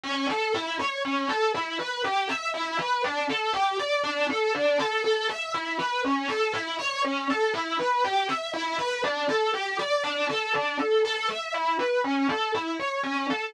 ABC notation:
X:1
M:3/4
L:1/8
Q:1/4=120
K:D
V:1 name="Acoustic Grand Piano"
C A E c C A | E B G e E B | D A G d D A | D A A e E B |
C A E c C A | E B G e E B | D A G d D A | D A A e E B |
C A E c C A |]